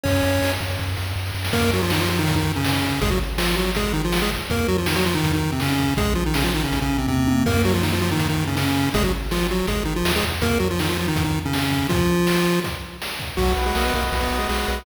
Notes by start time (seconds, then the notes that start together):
0.04 F#2 C#4 C#5, kick, ride
0.24 F#2, ride
0.42 F#2, snare
0.60 F#2, kick, ride
0.79 F#2, kick, snare
0.97 F#2, snare
1.16 F#2, snare
1.26 snare
1.34 F#2, snare
1.44 snare
1.53 F#2 A#3 A#4, kick, crash
1.73 F#3 F#4
1.82 F3 F4
1.90 D#3 D#4, snare
2.00 F3 F4
2.10 F3 F4
2.19 D#3 D#4
2.27 kick, closed hi-hat
2.36 D#3 D#4
2.56 C#3 C#4
2.64 C#3 C#4, snare
2.83 kick
3.01 G#1 G#3 G#4, kick, closed hi-hat
3.10 F#3 F#4
3.38 F3 F4, snare
3.57 F#3 F#4
3.75 G#3 G#4, kick, closed hi-hat
3.93 D#3 D#4
4.04 F3 F4
4.12 snare
4.22 G#3 G#4
4.31 kick
4.50 F2 A#3 A#4, kick, closed hi-hat
4.68 F#3 F#4
4.78 F3 F4
4.86 D#3 D#4, snare
4.96 F#3 F#4
5.06 F3 F4
5.15 D#3 D#4
5.23 F2, kick, closed hi-hat
5.33 D#3 D#4
5.52 C3 C4
5.60 C#3 C#4, snare
5.79 kick
5.97 A#1 G#3 G#4, kick, closed hi-hat
6.15 F3 F4
6.26 D#3 D#4
6.34 C#3 C#4, snare
6.44 F3 F4
6.54 D#3 D#4
6.64 C#3 C#4
6.72 A#1, kick, closed hi-hat
6.82 C#3 C#4
6.98 C3 C4
7.08 E2 C3 C4, kick, high tom
7.27 F2, high tom
7.46 F#2 A#3 A#4, kick, crash
7.65 F#3 F#4
7.74 F3 F4
7.83 D#3 D#4, snare
7.92 F3 F4
8.01 F3 F4
8.11 D#3 D#4
8.19 F#2, kick, closed hi-hat
8.29 D#3 D#4
8.47 C#3 C#4
8.57 C#3 C#4, snare
8.94 G#1 G#3 G#4, kick, closed hi-hat
9.04 F#3 F#4
9.31 F3 F4, snare
9.51 F#3 F#4
9.67 G#1 G#3 G#4, kick, closed hi-hat
9.85 D#3 D#4
9.96 F3 F4
10.05 D#2, snare
10.16 G#3 G#4
10.24 E2, kick
10.42 F2 A#3 A#4, kick, closed hi-hat
10.59 F#3 F#4
10.71 F3 F4
10.79 D#3 D#4, snare
10.89 F3 F4
10.98 F3 F4
11.08 D#3 D#4
11.16 F2, kick, closed hi-hat
11.24 D#3 D#4
11.45 C#3 C#4
11.53 C#3 C#4, snare
11.72 kick
11.89 F3 F4, kick, closed hi-hat
12.27 snare
12.64 kick, closed hi-hat
13.02 snare
13.20 kick
13.37 B1 F#3 F#4, kick, crash
13.56 B1 B4, ride
13.66 G#3 G#4
13.75 B1 A#3 A#4 D#5, snare
13.85 B3 B4
13.93 B1 A#3 F#4 A#4, kick, ride
14.11 B1 B4, kick, ride
14.21 B3 B4
14.31 B1 D#5, ride
14.39 G#3 G#4
14.49 B1 G#3 F#4 G#4, snare
14.68 B1 B4, ride